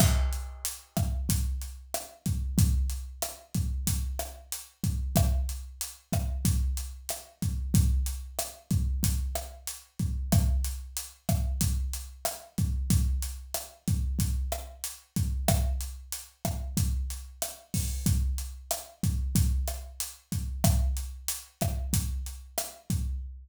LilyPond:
\new DrumStaff \drummode { \time 4/4 \tempo 4 = 93 <cymc bd ss>8 hh8 hh8 <hh bd ss>8 <hh bd>8 hh8 <hh ss>8 <hh bd>8 | <hh bd>8 hh8 <hh ss>8 <hh bd>8 <hh bd>8 <hh ss>8 hh8 <hh bd>8 | <hh bd ss>8 hh8 hh8 <hh bd ss>8 <hh bd>8 hh8 <hh ss>8 <hh bd>8 | <hh bd>8 hh8 <hh ss>8 <hh bd>8 <hh bd>8 <hh ss>8 hh8 <hh bd>8 |
<hh bd ss>8 hh8 hh8 <hh bd ss>8 <hh bd>8 hh8 <hh ss>8 <hh bd>8 | <hh bd>8 hh8 <hh ss>8 <hh bd>8 <hh bd>8 <hh ss>8 hh8 <hh bd>8 | <hh bd ss>8 hh8 hh8 <hh bd ss>8 <hh bd>8 hh8 <hh ss>8 <hho bd>8 | <hh bd>8 hh8 <hh ss>8 <hh bd>8 <hh bd>8 <hh ss>8 hh8 <hh bd>8 |
<hh bd ss>8 hh8 hh8 <hh bd ss>8 <hh bd>8 hh8 <hh ss>8 <hh bd>8 | }